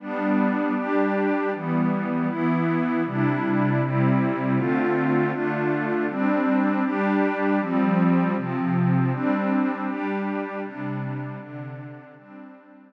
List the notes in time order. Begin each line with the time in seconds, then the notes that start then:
0.00 G3 B3 D4
0.75 G3 D4 G4
1.53 E3 G3 B3
2.27 E3 B3 E4
3.05 C3 G3 D4 E4
3.81 C3 G3 C4 E4
4.56 D3 A3 C4 F4
5.31 D3 A3 D4 F4
6.09 G3 C4 D4
6.84 G3 D4 G4
7.59 F3 G3 C4
8.36 C3 F3 C4
9.12 G3 C4 D4
9.87 G3 D4 G4
10.63 C3 G3 D4
11.39 C3 D3 D4
12.16 G3 C4 D4